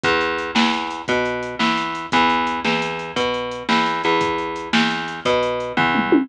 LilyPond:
<<
  \new Staff \with { instrumentName = "Electric Bass (finger)" } { \clef bass \time 12/8 \key e \major \tempo 4. = 115 e,4. e,4. b,4. e,4. | e,4. e,4. b,4. e,4 e,8~ | e,4. e,4. b,4. e,4. | }
  \new DrumStaff \with { instrumentName = "Drums" } \drummode { \time 12/8 <hh bd>8 hh8 hh8 sn8 hh8 hh8 <hh bd>8 hh8 hh8 sn8 hh8 hh8 | <hh bd>8 hh8 hh8 sn8 hh8 hh8 <hh bd>8 hh8 hh8 sn8 hh8 hh8 | <hh bd>8 hh8 hh8 sn8 hh8 hh8 <hh bd>8 hh8 hh8 <bd tomfh>8 toml8 tommh8 | }
>>